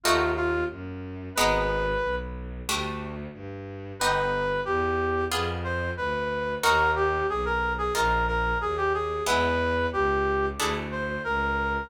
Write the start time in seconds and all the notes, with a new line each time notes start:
0.04 D#2 A3 D#4 F4 F#4
0.37 F4
0.70 F#2
1.35 G#1 G#3 B3 D#4 B4
2.02 B1
2.67 D2 G3 A3 D4
3.33 G2
3.99 G1 B3 D#4 G4 B4
4.65 E2 G4
5.31 F2 B3 F4 G#4
5.64 C5
5.97 D2 B4
6.63 D#2 A#3 D#4 F#4 A#4
6.96 G4
7.29 B1 G#4
7.45 A#4
7.78 G#4
7.95 A#1 A#3 D#4 F4 A#4
8.28 A#4
8.61 D#2 G#4
8.77 G4
8.94 G#4
9.27 E2 G#3 B3 E4 B4
9.93 C#2 G4
10.59 D2 A3 D4 E4 G#4
10.92 C5
11.24 C#2 A#4